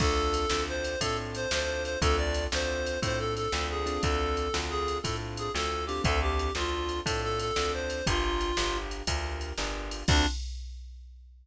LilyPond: <<
  \new Staff \with { instrumentName = "Clarinet" } { \time 12/8 \key d \minor \tempo 4. = 119 a'2 c''4 a'8 r8 c''8 c''4 c''8 | a'8 d''4 c''4. c''8 a'8 a'4 gis'4 | a'2 gis'4 a'8 r8 gis'8 a'4 g'8 | a'8 g'4 f'4. a'8 a'8 a'4 c''4 |
f'2~ f'8 r2. r8 | d'4. r1 r8 | }
  \new Staff \with { instrumentName = "Acoustic Grand Piano" } { \time 12/8 \key d \minor <c' d' f' a'>4. <c' d' f' a'>4. <c' d' f' a'>4. <c' d' f' a'>4. | <c' d' f' a'>4. <c' d' f' a'>4. <c' d' f' a'>4. <c' d' f' a'>4 <c' d' f' a'>8~ | <c' d' f' a'>4. <c' d' f' a'>4. <c' d' f' a'>4. <c' d' f' a'>4 <c' d' f' a'>8~ | <c' d' f' a'>4. <c' d' f' a'>4. <c' d' f' a'>4. <c' d' f' a'>4. |
<d' f' g' bes'>4. <d' f' g' bes'>4. <d' f' g' bes'>4. <d' f' g' bes'>4. | <c' d' f' a'>4. r1 r8 | }
  \new Staff \with { instrumentName = "Electric Bass (finger)" } { \clef bass \time 12/8 \key d \minor d,4. d,4. a,4. d,4. | d,4. d,4. a,4. d,4. | d,4. d,4. a,4. d,4. | d,4. d,4. a,4. d,4. |
g,,4. g,,4. d,4. g,,4. | d,4. r1 r8 | }
  \new DrumStaff \with { instrumentName = "Drums" } \drummode { \time 12/8 <cymc bd>4 cymr8 sn4 cymr8 <bd cymr>4 cymr8 sn4 cymr8 | <bd cymr>4 cymr8 sn4 cymr8 <bd cymr>4 cymr8 sn4 cymr8 | <bd cymr>4 cymr8 sn4 cymr8 <bd cymr>4 cymr8 sn4 cymr8 | <bd cymr>4 cymr8 sn4 cymr8 <bd cymr>4 cymr8 sn4 cymr8 |
<bd cymr>4 cymr8 sn4 cymr8 <bd cymr>4 cymr8 sn4 cymr8 | <cymc bd>4. r4. r4. r4. | }
>>